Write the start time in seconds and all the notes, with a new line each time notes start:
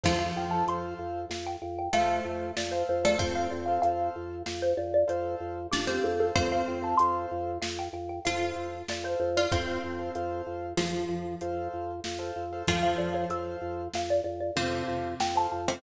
0.04 F2 F3 F4 A4 C5 F5, kick, crash
0.19 A4 C5 F5
0.36 F2 G5
0.50 A4 C5 F5 A5
0.67 F2 A4 C5 F5 C6, closed hi-hat
0.99 F2
1.30 F2 F5, snare
1.47 G5
1.62 F2 G5
1.79 G5
1.93 F2 A3 A4 C5 F5, closed hi-hat
2.25 F2
2.56 F2 D5, snare
2.71 A4 C5 F5
2.89 F2 C5
3.03 A3 A4 C5 D5 F5
3.18 F2 C4 A4 C5 F5, kick, closed hi-hat
3.35 A4 C5 F5
3.50 F2 D5
3.66 A4 C5 F5
3.82 F2 A4 C5 F5, closed hi-hat
4.16 F2
4.46 F2 F5, snare
4.62 C5
4.77 F2 D5
4.94 D5
5.08 F2 A4 C5 F5, closed hi-hat
5.40 F2
5.71 F2 D4 G4 D5, snare
5.87 C4 G4 A4 C5 F5
6.04 F2 A4
6.20 A4 C5 F5
6.35 F2 C4 A4 C5 F5, kick, closed hi-hat
6.52 A4 C5 F5
6.68 F2 G5
6.82 A4 C5 F5 A5
6.97 F2 A4 C5 F5 C6, closed hi-hat
7.31 F2
7.62 F2 F5, snare
7.79 G5
7.93 F2 G5
8.09 G5
8.25 F2 F4 A4 C5 F5, closed hi-hat
8.56 F2
8.88 F2 D5, snare
9.04 A4 C5 F5
9.20 F2 C5
9.37 F4 A4 C5 D5 F5
9.51 F2 C4 A4 C5 F5, kick, closed hi-hat
9.67 A4 C5 F5
9.84 F2
9.99 A4 C5 F5
10.15 F2 A4 C5 F5, closed hi-hat
10.47 F2
10.77 F2 F3 F4, snare
11.09 F2
11.41 F2 A4 C5 F5, closed hi-hat
11.73 F2
12.04 F2, snare
12.19 A4 C5 F5
12.36 F2
12.53 A4 C5 F5
12.68 F2 F3 F4 A4 C5 F5, kick, closed hi-hat
12.83 A4 C5 F5
12.98 F2 D5
13.13 A4 C5 C#5 F5
13.29 F2 A4 C5 F5, closed hi-hat
13.61 F2
13.94 F2 F5, snare
14.10 D5
14.24 F2 D5
14.41 D5
14.56 F2 C3 C4 A4 C5 F5, closed hi-hat
14.88 F2
15.20 F2 G5, snare
15.35 A4 C5 F5 A5
15.52 F2 A5
15.68 C3 C4 A4 C5 F5 G5